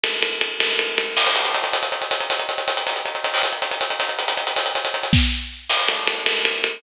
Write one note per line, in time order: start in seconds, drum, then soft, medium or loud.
0.04 ride loud
0.22 ride medium
0.41 ride medium
0.60 ride loud
0.79 ride medium
0.98 ride medium
1.17 crash loud
1.26 closed hi-hat medium
1.36 closed hi-hat loud
1.45 closed hi-hat medium
1.54 closed hi-hat loud
1.64 closed hi-hat medium
1.73 closed hi-hat loud
1.83 closed hi-hat medium
1.92 closed hi-hat medium
2.02 closed hi-hat medium
2.11 closed hi-hat loud
2.20 closed hi-hat medium
2.30 closed hi-hat loud
2.39 closed hi-hat medium
2.49 closed hi-hat medium
2.58 closed hi-hat medium
2.68 closed hi-hat loud
2.77 closed hi-hat medium
2.87 closed hi-hat loud
2.96 closed hi-hat medium
3.06 closed hi-hat medium
3.15 closed hi-hat medium
3.24 closed hi-hat loud
3.34 open hi-hat medium
3.43 closed hi-hat loud
3.53 closed hi-hat medium
3.62 closed hi-hat medium
3.71 closed hi-hat medium
3.81 closed hi-hat loud
3.90 closed hi-hat medium
4.00 closed hi-hat loud
4.09 closed hi-hat medium
4.19 closed hi-hat medium
4.28 closed hi-hat loud
4.37 closed hi-hat medium
4.47 closed hi-hat medium
4.56 closed hi-hat loud
4.66 closed hi-hat medium
4.75 closed hi-hat medium
4.85 closed hi-hat medium
4.94 closed hi-hat medium
5.03 closed hi-hat medium
5.13 kick medium
5.13 snare loud
5.69 crash loud
5.88 ride medium
6.07 ride medium
6.26 ride loud
6.45 ride medium
6.64 ride medium